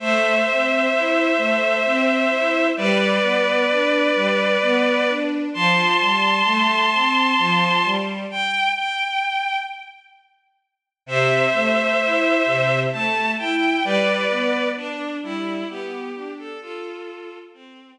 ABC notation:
X:1
M:3/4
L:1/16
Q:1/4=65
K:Am
V:1 name="Violin"
[ce]12 | [Bd]12 | [ac']12 | g2 g4 z6 |
[ce]8 a2 g2 | [Bd]4 D2 E2 G3 A | [FA]4 C2 z6 |]
V:2 name="String Ensemble 1"
A,2 C2 E2 A,2 C2 E2 | G,2 B,2 D2 G,2 B,2 D2 | F,2 G,2 A,2 C2 F,2 G,2 | z12 |
C,2 A,2 E2 C,2 A,2 E2 | G,2 B,2 D2 G,2 B,2 D2 | z12 |]